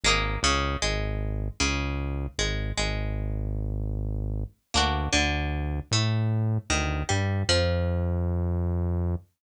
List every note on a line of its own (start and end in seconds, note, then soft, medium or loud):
0.03 0.37 G#1 loud
0.03 0.40 G#3 loud
0.03 0.40 A#3 loud
0.08 0.40 D#4 medium
0.43 0.76 C#2 loud
0.43 0.77 C#3 loud
0.82 1.49 G#1 medium
0.82 1.49 G#3 medium
1.60 2.27 C#2 loud
1.60 2.27 C#3 medium
2.38 2.72 G#1 medium
2.38 2.72 G#3 medium
2.77 4.44 G#1 medium
2.77 4.44 G#3 medium
4.74 5.08 D2 loud
4.74 5.09 A#3 medium
4.74 5.09 D4 medium
4.74 5.09 F#4 medium
5.12 5.80 D2 loud
5.12 5.79 D3 medium
5.91 6.58 A2 medium
5.91 6.59 A3 medium
6.70 7.03 D2 loud
6.70 7.03 D#3 medium
7.09 7.43 G2 medium
7.09 7.42 G3 medium
7.49 9.15 F2 loud
7.49 9.16 F3 loud